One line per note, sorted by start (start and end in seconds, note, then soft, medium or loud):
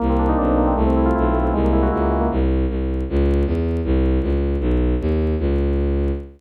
0.00 0.34 C2 loud
0.00 0.57 A#3 loud
0.09 0.48 C4 medium
0.19 0.38 D4 medium
0.29 0.74 D#4 medium
0.38 0.73 B1 medium
0.38 0.75 D4 medium
0.48 0.67 C4 medium
0.58 0.76 A#3 medium
0.67 0.77 C4 medium
0.76 1.11 C2 loud
0.76 1.34 A3 medium
0.87 1.24 C4 medium
0.96 1.15 E4 medium
1.06 1.51 F4 medium
1.16 1.52 B1 medium
1.16 1.52 E4 medium
1.25 1.44 C4 medium
1.35 1.53 A3 medium
1.44 1.53 C4 medium
1.53 1.88 C2 loud
1.53 2.11 G#3 medium
1.64 2.01 A#3 medium
1.73 1.92 E4 medium
1.83 2.28 F#4 medium
1.92 2.27 C#2 medium
1.92 2.29 E4 medium
2.02 2.21 A#3 medium
2.12 2.30 G#3 medium
2.21 2.30 A#3 medium
2.31 2.65 C2 loud
2.69 3.03 C2 medium
3.09 3.44 C#2 loud
3.46 3.81 E2 medium
3.84 4.19 C2 loud
4.22 4.57 C#2 loud
4.60 4.95 B1 loud
5.00 5.35 D#2 loud
5.39 6.11 C#2 loud